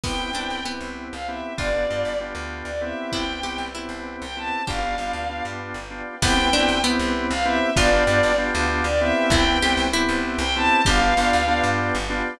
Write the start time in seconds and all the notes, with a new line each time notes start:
0.03 C2 B3 C4 E4 G4 B4 C5 E5 G5, kick, crash
0.19 B3 C4 E4 G4
0.33 C2 B3 C4 D4 E4 G4
0.50 C2
0.65 B3 C4 E4 G4
0.81 C2
1.12 C2 F5
1.28 B3 C4 E4 G4 E5
1.57 G1 B3 D4 F4 G4 B4 D5 F5 G5, kick
1.73 B3 D4 F4 G4
1.89 G2 B3 D4 F4 G4
2.05 G1
2.20 B3 D4 F4 G4
2.35 D2
2.65 D2 D5
2.81 B3 C4 E4 G4 E5
3.12 C2 E4 B4 C5 E5 G5, kick
3.28 B3 C4 E4 G4
3.43 C2 B3 C4 E4 G4
3.58 C2
3.75 B3 C4 E4 G4
3.89 C2
4.22 C2 G5
4.37 B3 C4 E4 G4 A5
4.67 G1 B3 D4 F4 G4 B4 D5 F5 G5, kick
4.83 B3 D4 F4 G4
4.98 G1 B3 D4 F4 G4
5.13 D2
5.30 B3 D4 F4 G4
5.45 G2
5.74 G1
5.91 B3 D4 F4 G4
6.22 C2 B3 C4 E4 G4 B4 C5 E5 G5, kick, crash
6.37 B3 C4 E4 G4
6.53 C2 B3 C4 D4 E4 G4
6.68 C2
6.84 B3 C4 E4 G4
6.99 C2
7.31 C2 F5
7.45 B3 C4 E4 G4 E5
7.76 G1 B3 D4 F4 G4 B4 D5 F5 G5, kick
7.93 B3 D4 F4 G4
8.07 G2 B3 D4 F4 G4
8.23 G1
8.38 B3 D4 F4 G4
8.55 D2
8.84 D2 D5
9.01 B3 C4 E4 G4 E5
9.30 C2 E4 B4 C5 E5 G5, kick
9.47 B3 C4 E4 G4
9.62 C2 B3 C4 E4 G4
9.77 C2
9.93 B3 C4 E4 G4
10.09 C2
10.39 C2 G5
10.55 B3 C4 E4 G4 A5
10.85 G1 B3 D4 F4 G4 B4 D5 F5 G5, kick
11.01 B3 D4 F4 G4
11.17 G1 B3 D4 F4 G4
11.33 D2
11.48 B3 D4 F4 G4
11.64 G2
11.95 G1
12.10 B3 D4 F4 G4